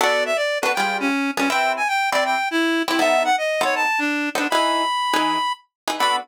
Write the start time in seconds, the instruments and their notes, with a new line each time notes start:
0.01 acoustic guitar (steel) B3 D4 F#4 A4, clarinet D5
0.26 clarinet E5
0.36 clarinet D5
0.62 acoustic guitar (steel) B3 D4 F#4 A4, clarinet B4
0.74 acoustic guitar (steel) G3 F4 G#4 B4, clarinet G5
1.00 clarinet C#4
1.37 acoustic guitar (steel) G3 F4 G#4 B4, clarinet C#4
1.50 acoustic guitar (steel) C4 E4 G4 B4, clarinet G5
1.77 clarinet G#5
1.88 clarinet G5
2.12 acoustic guitar (steel) C4 E4 G4 B4, clarinet D5
2.25 clarinet G5
2.51 clarinet E4
2.88 acoustic guitar (steel) C4 E4 G4 B4, clarinet E4
2.99 acoustic guitar (steel) B3 D#4 A4 C5, clarinet E5
3.24 clarinet F#5
3.38 clarinet D#5
3.61 acoustic guitar (steel) B3 D#4 A4 C5, clarinet C#5
3.75 clarinet A5
3.99 clarinet D4
4.35 acoustic guitar (steel) B3 D#4 A4 C5, clarinet D4
4.50 acoustic guitar (steel) E3 D#4 G#4 B4, clarinet B5
5.14 acoustic guitar (steel) E3 D#4 G#4 B4
5.88 acoustic guitar (steel) E3 D#4 G#4 B4
5.99 acoustic guitar (steel) B3 D4 F#4 A4, clarinet B5